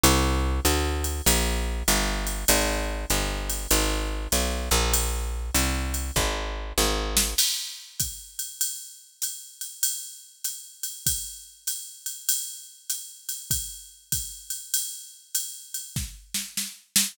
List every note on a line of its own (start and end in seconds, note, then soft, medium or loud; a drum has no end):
0.03 0.60 C2 loud
0.03 ride loud
0.65 1.22 D2 medium
0.65 hi-hat pedal medium
0.65 ride medium
1.04 ride medium
1.26 1.83 A#1 medium
1.26 ride loud
1.88 2.45 G1 medium
1.88 hi-hat pedal medium
1.88 ride medium
2.27 ride medium
2.48 3.05 G#1 loud
2.48 ride loud
3.10 3.67 G1 medium
3.10 hi-hat pedal medium
3.10 ride medium
3.49 ride medium
3.71 4.28 G#1 medium
3.71 ride loud
4.32 4.69 B1 medium
4.32 hi-hat pedal medium
4.32 ride medium
4.71 5.51 A#1 medium
4.71 ride medium
4.93 ride loud
5.54 6.11 C2 medium
5.54 hi-hat pedal medium
5.54 ride medium
5.94 ride medium
6.16 6.73 G#1 medium
6.16 kick medium
6.16 snare medium
6.78 7.34 G#1 medium
6.78 snare medium
7.17 snare loud
7.38 crash loud
7.38 ride loud
8.00 kick medium
8.00 hi-hat pedal medium
8.00 ride medium
8.39 ride medium
8.61 ride medium
9.22 hi-hat pedal medium
9.22 ride medium
9.61 ride medium
9.83 ride loud
10.44 hi-hat pedal medium
10.44 ride medium
10.83 ride medium
11.06 kick medium
11.06 ride loud
11.67 hi-hat pedal medium
11.67 ride medium
12.06 ride medium
12.29 ride loud
12.90 hi-hat pedal medium
12.90 ride medium
13.29 ride medium
13.51 kick medium
13.51 ride medium
14.12 kick medium
14.12 hi-hat pedal medium
14.12 ride medium
14.50 ride medium
14.74 ride loud
15.35 hi-hat pedal medium
15.35 ride medium
15.74 ride medium
15.96 kick medium
15.96 snare medium
16.34 snare medium
16.57 snare medium
16.96 snare loud